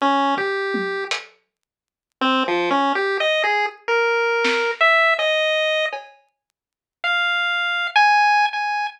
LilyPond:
<<
  \new Staff \with { instrumentName = "Lead 1 (square)" } { \time 4/4 \tempo 4 = 81 des'8 g'4 r4. \tuplet 3/2 { c'8 f8 des'8 } | \tuplet 3/2 { g'8 ees''8 aes'8 } r16 bes'4~ bes'16 e''8 ees''4 | r4. f''4~ f''16 aes''8. aes''8 | }
  \new DrumStaff \with { instrumentName = "Drums" } \drummode { \time 4/4 r8 bd8 tommh8 hh8 r4 r4 | r4 r4 sn4 cb4 | cb4 r4 r4 r4 | }
>>